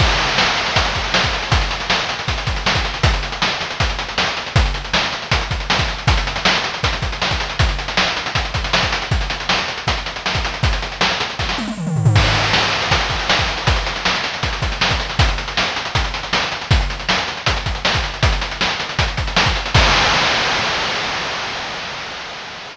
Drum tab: CC |x---------------|----------------|----------------|----------------|
HH |-xxx-xxxxxxx-xxx|xxxx-xxxxxxx-xxx|xxxx-xxxxxxx-xxx|xxxx-xxxxxxx-xxx|
SD |----o-------o---|----o-------o---|----o-------o---|----o-------o---|
T1 |----------------|----------------|----------------|----------------|
T2 |----------------|----------------|----------------|----------------|
FT |----------------|----------------|----------------|----------------|
BD |o-------o-o--o--|o-------o-o--o--|o-------o-------|o-------o-o--o--|

CC |----------------|----------------|----------------|----------------|
HH |xxxx-xxxxxxx-xxx|xxxx-xxxxxxx-xxx|xxxx-xxxxxxx-xxx|xxxx-xxx--------|
SD |----o-------o---|----o-------o---|----o-------o---|----o---oo------|
T1 |----------------|----------------|----------------|----------oo----|
T2 |----------------|----------------|----------------|------------oo--|
FT |----------------|----------------|----------------|--------------oo|
BD |o-------o-o--o--|o-------o-o--o--|o-------o----o--|o-------o-------|

CC |x---------------|----------------|----------------|----------------|
HH |-xxx-xxxxxxx-xxx|xxxx-xxxxxxx-xxx|xxxx-xxxxxxx-xxx|xxxx-xxxxxxx-xxx|
SD |----o-------o---|----o-------o---|----o-------o---|----o-------o---|
T1 |----------------|----------------|----------------|----------------|
T2 |----------------|----------------|----------------|----------------|
FT |----------------|----------------|----------------|----------------|
BD |o-------o-o--o--|o-------o-o--o--|o-------o-------|o-------o-o--o--|

CC |----------------|x---------------|
HH |xxxx-xxxxxxx-xxx|----------------|
SD |----o-------o---|----------------|
T1 |----------------|----------------|
T2 |----------------|----------------|
FT |----------------|----------------|
BD |o-------o-o--o--|o---------------|